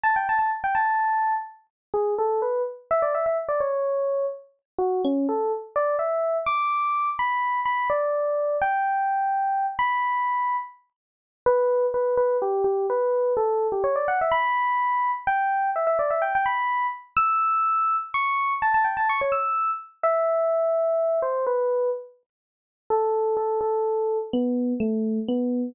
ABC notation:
X:1
M:12/8
L:1/16
Q:3/8=84
K:Amix
V:1 name="Electric Piano 1"
a g a a z g a6 z4 ^G2 A2 B2 z2 | e d e e z d c6 z4 F2 C2 A2 z2 | d2 e4 d'6 b4 b2 d6 | g10 b8 z6 |
B4 B2 B2 G2 G2 B4 A3 G c d f e | b8 g4 e e d e g g b4 z2 | e'8 c'4 a a g a c' c e'4 z2 | e10 =c2 B4 z8 |
A4 A2 A6 B,4 A,4 B,4 |]